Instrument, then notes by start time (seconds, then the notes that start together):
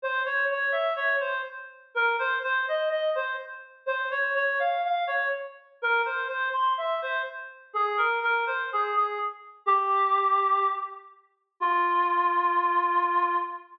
clarinet
0.02 C5
0.26 C#5
0.51 C#5
0.72 E5
0.96 C#5
1.20 C5
1.94 A#4
2.19 C5
2.43 C5
2.68 D#5
2.89 D#5
3.15 C5
3.86 C5
4.11 C#5
4.35 C#5
4.59 F5
4.85 F5
5.07 C#5
5.82 A#4
6.06 C5
6.28 C5
6.53 C6
6.78 E5
7.02 C5
7.73 G#4
7.97 A#4
8.23 A#4
8.47 C5
8.73 G#4
8.96 G#4
9.66 G4
11.60 F4